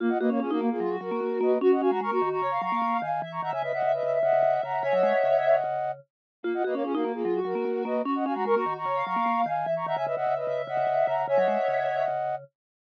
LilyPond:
<<
  \new Staff \with { instrumentName = "Flute" } { \time 4/4 \key fis \mixolydian \tempo 4 = 149 r16 <dis'' fis''>16 <b' dis''>16 <ais' cis''>16 <eis' gis'>16 <fis' ais'>8 <eis' gis'>8. <fis' ais'>4 <b' dis''>8 | r16 <dis'' fis''>16 <eis'' gis''>16 <fis'' ais''>16 <ais'' cis'''>16 <ais'' cis'''>8 <ais'' cis'''>8. <ais'' cis'''>4 <eis'' gis''>8 | r16 <ais'' cis'''>16 <fis'' ais''>16 <e'' gis''>16 <b' dis''>16 <dis'' fis''>8 <b' dis''>8. <dis'' fis''>4 <fis'' ais''>8 | <e'' gis''>16 <dis'' fis''>2~ <dis'' fis''>8. r4 |
r16 <dis'' fis''>16 <b' dis''>16 <ais' cis''>16 <eis' gis'>16 <fis' ais'>8 <eis' gis'>8. <fis' ais'>4 <b' dis''>8 | r16 <dis'' fis''>16 <eis'' gis''>16 <fis'' ais''>16 <ais'' cis'''>16 <ais'' cis'''>8 <ais'' cis'''>8. <ais'' cis'''>4 <eis'' gis''>8 | r16 <ais'' cis'''>16 <fis'' ais''>16 <e'' gis''>16 <b' dis''>16 <dis'' fis''>8 <b' dis''>8. <dis'' fis''>4 <fis'' ais''>8 | <e'' gis''>16 <dis'' fis''>2~ <dis'' fis''>8. r4 | }
  \new Staff \with { instrumentName = "Ocarina" } { \time 4/4 \key fis \mixolydian ais16 r16 ais16 ais16 cis'16 ais16 ais16 ais16 eis'16 fis'4.~ fis'16 | fis'16 r16 fis'16 fis'16 ais'16 fis'16 fis'16 fis'16 cis''16 eis''4.~ eis''16 | e''16 r16 e''16 e''16 e''16 e''16 e''16 e''16 e''16 e''4.~ e''16 | <cis'' e''>2 r2 |
ais16 r16 ais16 ais16 cis'16 ais16 ais16 ais16 eis'16 fis'4.~ fis'16 | fis'16 r16 fis'16 fis'16 ais'16 fis'16 fis'16 fis'16 cis''16 eis''4.~ eis''16 | e''16 r16 e''16 e''16 e''16 e''16 e''16 e''16 e''16 e''4.~ e''16 | <cis'' e''>2 r2 | }
  \new Staff \with { instrumentName = "Vibraphone" } { \time 4/4 \key fis \mixolydian eis'8 fis'16 cis'16 cis'16 dis'16 ais8 fis8 fis16 ais16 ais8 ais8 | cis'8 cis'16 gis16 gis16 ais16 dis8 cis8 fis16 ais16 ais8 dis8 | e8 dis16 cis16 cis16 cis16 cis8 cis8 cis16 cis16 cis8 cis8 | cis16 fis16 gis16 r16 cis4 cis4 r4 |
eis'8 fis'16 cis'16 cis'16 dis'16 ais8 fis8 fis16 ais16 ais8 ais8 | cis'8 cis'16 gis16 gis16 ais16 dis8 cis8 fis16 ais16 ais8 dis8 | e8 dis16 cis16 cis16 cis16 cis8 cis8 cis16 cis16 cis8 cis8 | cis16 fis16 gis16 r16 cis4 cis4 r4 | }
>>